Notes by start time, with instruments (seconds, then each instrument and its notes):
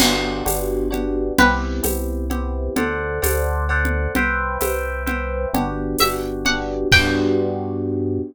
0.00 synth bass 1 G1, electric piano 1 B3 D4 F#4 G4, crash, cowbell, low conga
0.45 synth bass 1 G1, electric piano 1 B3 D4 F#4 G4, tambourine, cowbell, high conga
0.91 electric piano 1 B3 D4 F#4 G4, cowbell, low conga
1.38 synth bass 1 C2, electric piano 1 B3 C4 E4 G4, pizzicato strings B4, cowbell, low conga
1.83 synth bass 1 C2, electric piano 1 B3 C4 E4 G4, tambourine, cowbell, high conga
2.30 electric piano 1 B3 C4 E4 G4, cowbell, low conga
2.76 synth bass 1 D2, electric piano 1 A4 C5 D5 F#5, cowbell, low conga
3.22 synth bass 1 D2, electric piano 1 A4 C5 D5 F#5, tambourine, cowbell, high conga
3.69 electric piano 1 A4 C5 D5 F#5, cowbell
3.85 low conga
4.15 synth bass 1 C2, electric piano 1 B4 C5 E5 G5, cowbell, low conga
4.61 synth bass 1 C2, electric piano 1 B4 C5 E5 G5, tambourine, cowbell, high conga
5.06 electric piano 1 B4 C5 E5 G5, cowbell, low conga
5.53 synth bass 1 G1, electric piano 1 B3 D4 F#4 G4, cowbell, low conga
5.98 synth bass 1 G1, electric piano 1 B3 D4 F#4 G4, pizzicato strings E5, tambourine, cowbell, high conga
6.45 electric piano 1 B3 D4 F#4 G4, pizzicato strings F#5, cowbell, low conga
6.92 synth bass 1 G2, electric piano 1 B3 D4 F#4 G4, pizzicato strings G5, kick, crash